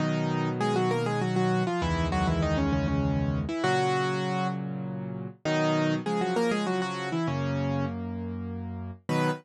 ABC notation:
X:1
M:3/4
L:1/16
Q:1/4=99
K:B
V:1 name="Acoustic Grand Piano"
[D,D]4 [G,G] [F,F] [A,A] [G,G] [F,F] [F,F]2 [=F,=F] | [E,E]2 [F,F] [E,E] [D,D] [C,C] [C,C] [C,C]4 [E,E] | [F,F]6 z6 | [D,D]4 [G,G] [F,F] [A,A] [G,G] [F,F] [F,F]2 [E,E] |
[C,C]4 z8 | B4 z8 |]
V:2 name="Acoustic Grand Piano"
[B,,D,F,]12 | [C,,E,,D,G,]12 | [A,,C,F,]12 | [B,,D,F,]4 [C,^E,]8 |
[F,,A,]12 | [B,,D,F,]4 z8 |]